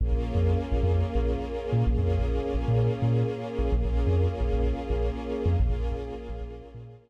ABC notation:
X:1
M:4/4
L:1/16
Q:1/4=129
K:Bbm
V:1 name="String Ensemble 1"
[B,DFA]16 | [B,DFA]16 | [B,DFA]16 | [B,DFA]16 |]
V:2 name="Synth Bass 2" clef=bass
B,,, B,,,2 F,,3 B,,, F,,3 B,,,5 B,, | B,,, F,,2 B,,,3 B,,, B,,3 B,,5 B,,, | B,,, B,,,2 F,,3 B,,, B,,,3 B,,,5 F,, | B,,, B,,,2 B,,,3 B,,, B,,,3 B,,5 z |]